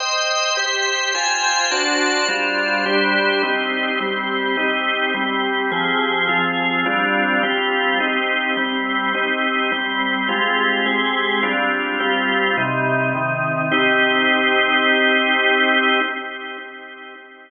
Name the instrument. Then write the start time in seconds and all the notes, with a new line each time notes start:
drawbar organ
0.00 C5 D#5 G5
0.57 G4 C5 G5
1.15 F4 C5 G5 G#5
1.71 D4 F#4 C5 A5
2.28 G3 D4 F4 C5
2.86 G3 D4 G4 C5
3.43 C4 D#4 G4
4.00 G3 C4 G4
4.57 C4 D#4 G4
5.14 G3 C4 G4
5.72 F3 C4 G4 G#4
6.29 F3 C4 F4 G#4
6.86 G3 C4 D4 F4
7.43 G3 C4 F4 G4
8.00 C4 D#4 G4
8.57 G3 C4 G4
9.14 C4 D#4 G4
9.72 G3 C4 G4
10.29 G#3 C4 F4 G4
10.86 G#3 C4 G4 G#4
11.43 G3 C4 D4 F4
12.00 G3 C4 F4 G4
12.57 C3 G3 D#4
13.15 C3 D#3 D#4
13.72 C4 D#4 G4